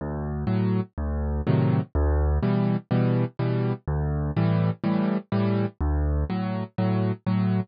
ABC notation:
X:1
M:4/4
L:1/8
Q:1/4=124
K:D
V:1 name="Acoustic Grand Piano" clef=bass
D,,2 [A,,F,]2 D,,2 [A,,=C,^D,F,]2 | D,,2 [B,,E,G,]2 [B,,E,G,]2 [B,,E,G,]2 | D,,2 [A,,E,G,]2 [A,,E,G,]2 [A,,E,G,]2 | D,,2 [A,,F,]2 [A,,F,]2 [A,,F,]2 |]